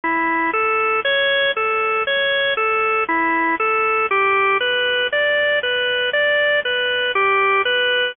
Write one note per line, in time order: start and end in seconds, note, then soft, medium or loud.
0.04 0.51 E4 medium
0.53 1.00 A4 medium
1.05 1.51 C#5 loud
1.57 2.03 A4 medium
2.07 2.54 C#5 medium
2.57 3.04 A4 medium
3.09 3.55 E4 medium
3.60 4.06 A4 medium
4.11 4.58 G4 loud
4.61 5.07 B4 medium
5.12 5.59 D5 loud
5.63 6.10 B4 medium
6.13 6.60 D5 loud
6.65 7.12 B4 medium
7.15 7.62 G4 loud
7.65 8.12 B4 medium